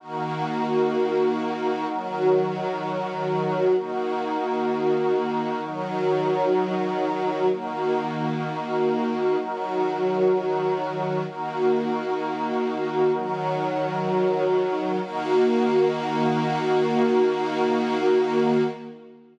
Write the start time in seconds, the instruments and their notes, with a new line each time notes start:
0.00 string ensemble 1 D#3 A#3 F#4, pad 5 (bowed) D#4 F#4 A#4
1.88 string ensemble 1 D#3 F#3 F#4
3.74 string ensemble 1 D#3 A#3 F#4, pad 5 (bowed) D#4 F#4 A#4
5.62 string ensemble 1 D#3 F#3 F#4
7.50 string ensemble 1 D#3 A#3 F#4, pad 5 (bowed) D#4 F#4 A#4
9.38 string ensemble 1 D#3 F#3 F#4
11.25 string ensemble 1 D#3 A#3 F#4, pad 5 (bowed) D#4 F#4 A#4
13.13 string ensemble 1 D#3 F#3 F#4
15.00 string ensemble 1 D#3 A#3 F#4, pad 5 (bowed) D#4 F#4 A#4